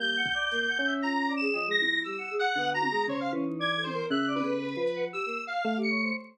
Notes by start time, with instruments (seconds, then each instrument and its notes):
0.00 choir aahs G3, electric piano 1 A#3, lead 1 (square) G6
0.17 choir aahs F#5
0.26 kick
0.34 choir aahs D5
0.51 choir aahs A#3, closed hi-hat
0.68 choir aahs F#5
0.79 electric piano 1 C#4
0.86 choir aahs E5
1.02 choir aahs F4, lead 1 (square) A#5
1.28 choir aahs D5
1.36 lead 1 (square) E7
1.41 choir aahs G#4
1.54 electric piano 1 F3, choir aahs D#5, cowbell
1.67 choir aahs G#3
1.71 lead 1 (square) A#6
1.79 choir aahs E4, high tom
2.04 choir aahs G3, lead 1 (square) E6, closed hi-hat
2.18 choir aahs F#5
2.31 choir aahs G#4
2.39 lead 1 (square) F#5
2.56 electric piano 1 D3, choir aahs B3
2.74 choir aahs F#4, lead 1 (square) A#5
2.82 high tom
2.91 choir aahs G#3
3.07 electric piano 1 C#3, choir aahs C5, lead 1 (square) C#5, floor tom
3.20 lead 1 (square) F5
3.33 electric piano 1 E3, choir aahs C#4
3.46 choir aahs D#4
3.59 choir aahs D5, lead 1 (square) G#6
3.76 choir aahs A4
3.83 lead 1 (square) C5, high tom
3.93 choir aahs A#4
4.10 electric piano 1 C#3, choir aahs E5, lead 1 (square) F#6
4.27 choir aahs D5
4.35 lead 1 (square) B4, high tom
4.44 electric piano 1 C#3, choir aahs A4
4.62 choir aahs B4
4.77 electric piano 1 F3, choir aahs B4
4.87 closed hi-hat
4.96 choir aahs F#5
5.13 choir aahs G4, lead 1 (square) E6
5.26 choir aahs A#3
5.47 lead 1 (square) F5
5.65 electric piano 1 A3
5.77 choir aahs G4
5.82 lead 1 (square) C#7
5.90 choir aahs C#5
6.02 choir aahs C5